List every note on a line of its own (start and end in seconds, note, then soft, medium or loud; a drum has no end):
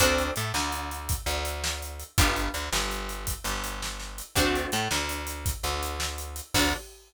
0.00 0.31 D2 medium
0.00 0.33 C4 loud
0.00 0.33 D4 loud
0.00 0.33 F#4 loud
0.00 0.33 A4 loud
0.00 kick loud
0.00 closed hi-hat loud
0.18 closed hi-hat medium
0.36 0.52 A2 medium
0.36 0.52 A3 medium
0.36 closed hi-hat loud
0.54 1.16 D2 medium
0.54 1.16 D3 medium
0.54 snare loud
0.72 closed hi-hat medium
0.91 closed hi-hat medium
1.09 kick loud
1.09 closed hi-hat loud
1.26 2.03 D2 medium
1.26 2.05 D3 medium
1.26 closed hi-hat medium
1.45 closed hi-hat loud
1.64 snare loud
1.82 closed hi-hat medium
2.00 closed hi-hat medium
2.18 2.49 G1 medium
2.18 2.51 B3 loud
2.18 2.51 D4 loud
2.18 2.51 F4 loud
2.18 2.51 G4 loud
2.18 kick loud
2.18 closed hi-hat loud
2.36 closed hi-hat medium
2.54 2.70 D2 medium
2.54 2.69 D3 medium
2.54 closed hi-hat medium
2.72 3.34 G1 medium
2.72 3.35 G3 medium
2.72 snare loud
2.91 closed hi-hat medium
3.09 closed hi-hat medium
3.27 kick medium
3.27 closed hi-hat loud
3.44 4.22 G1 medium
3.44 4.23 G3 medium
3.44 closed hi-hat medium
3.64 closed hi-hat medium
3.82 snare loud
3.99 snare medium
4.18 closed hi-hat medium
4.35 4.66 D2 medium
4.35 4.70 A3 medium
4.35 4.70 C4 loud
4.35 4.70 D4 loud
4.35 4.70 F#4 loud
4.35 kick loud
4.35 closed hi-hat loud
4.55 closed hi-hat medium
4.72 4.88 A2 medium
4.72 4.88 A3 medium
4.72 closed hi-hat medium
4.91 5.53 D2 medium
4.91 5.53 D3 medium
4.91 snare loud
5.09 closed hi-hat loud
5.27 closed hi-hat loud
5.46 kick loud
5.46 closed hi-hat loud
5.63 6.41 D2 medium
5.63 6.41 D3 medium
5.63 closed hi-hat medium
5.83 closed hi-hat medium
6.00 snare loud
6.18 closed hi-hat medium
6.36 closed hi-hat medium
6.54 6.73 D2 loud
6.54 6.75 C4 medium
6.54 6.75 D4 loud
6.54 6.75 F#4 medium
6.54 6.75 A4 medium
6.54 kick loud
6.54 crash loud